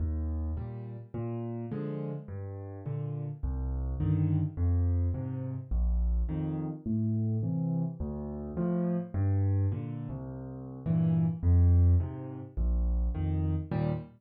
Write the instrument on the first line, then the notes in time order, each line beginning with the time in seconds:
acoustic grand piano
0.00 D#2
0.57 A#2 G3
1.14 A#2
1.72 D3 F3 G#3
2.28 G2
2.86 A#2 D3
3.43 C2
4.00 G2 D3 D#3
4.57 F2
5.14 G#2 C3
5.71 A#1
6.29 F2 D#3
6.86 A2
7.43 C3 E3
8.00 D2
8.57 A2 F3
9.14 G2
9.72 A#2 D3
10.09 C2
10.86 G2 A#2 E3
11.43 F2
12.00 G#2 C3
12.57 A#1
13.15 F2 D#3
13.72 D#2 A#2 G3